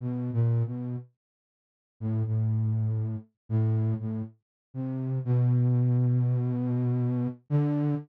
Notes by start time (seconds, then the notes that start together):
0.01 B2
0.33 A#2
0.66 B2
2.00 A2
2.26 A2
3.49 A2
4.00 A2
4.74 C3
5.25 B2
7.50 D3